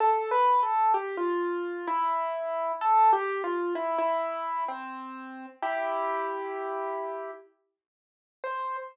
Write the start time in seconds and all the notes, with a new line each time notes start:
0.00 A4
0.31 B4
0.63 A4
0.94 G4
1.17 F4
1.88 E4
2.81 A4
3.13 G4
3.44 F4
3.75 E4
3.98 E4
4.68 C4
5.62 E4 G4
8.44 C5